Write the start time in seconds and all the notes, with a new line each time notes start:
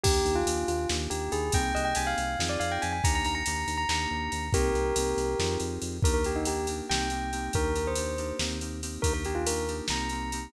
0.03 D#2 A#3 D4 D#4 G4, kick, crash
0.25 D#2, ride
0.36 F4
0.46 D#2 A#3 D4 D#4 G4, ride
0.68 D#2 F4, ride
0.89 D#2 A#3 D4 D#4 G4, snare
1.10 D#2 G4, ride
1.32 D#2 G#4, ride
1.52 C2 A#3 C4 D#4 G4 G5, kick, ride
1.75 C2 D#5, ride
1.85 G5
1.95 C2 A#3 C4 D#4 G4 G#5, ride
2.07 F5
2.18 C2, ride
2.39 F2 C4 D#4 F4 G#4, snare
2.49 D5
2.60 F2 F5, ride
2.72 G5
2.82 F2 G#5, ride
2.93 G#5
3.04 D#2 A#3 D4 D#4 G4 A#5, kick, ride
3.15 A#5
3.25 D#2 A#5, ride
3.35 A#5
3.46 D#2 A#3 D4 D#4 G4, ride
3.67 D#2, ride
3.78 A#5
3.89 D#2 A#3 D4 D#4 G4 A#5, snare
4.11 D#2
4.32 D#2, ride
4.53 C2 A#3 C4 D#4 G4 A#4, kick, ride
4.75 C2, ride
4.96 C2 A#3 C4 D#4 G4, ride
5.17 C2, ride
5.39 F2 C4 D#4 F4 G#4, snare
5.60 F2, ride
5.82 F2, ride
6.02 D#2 A#3 D4 D#4 G4 A#4, kick, ride
6.14 A#4
6.24 A#3 D4 D#4 G4, ride
6.36 D#4
6.45 A#3 D4 D#4 G4, ride
6.67 A#3 D4 D#4 G4, ride
6.89 C2 A#3 C4 D#4 G4 G5, snare
7.10 A#3 C4 D#4 G4, ride
7.32 A#3 C4 D#4 G4, ride
7.53 D#2 A#3 D4 D#4 G4 A#4, kick, ride
7.75 A#3 D4 D#4 G4, ride
7.87 C5
7.96 A#3 D4 D#4 G4, ride
8.18 A#3 D4 D#4 G4, ride
8.39 D#2 A#3 C4 D#4 G4, snare
8.61 A#3 C4 D#4 G4, ride
8.82 A#3 C4 D#4 G4, ride
9.02 D#2 A#3 D4 D#4 G4 A#4, kick, ride
9.13 A#4
9.25 A#3 D4 D#4 G4, ride
9.35 F4
9.47 A#3 D4 D#4 G4 A#4, ride
9.68 A#3 D4 D#4 G4, ride
9.88 C2 A#3 C4 D#4 G4 A#5, snare
10.09 A#3 C4 D#4 G4, ride
10.32 A#3 C4 D#4 G4, ride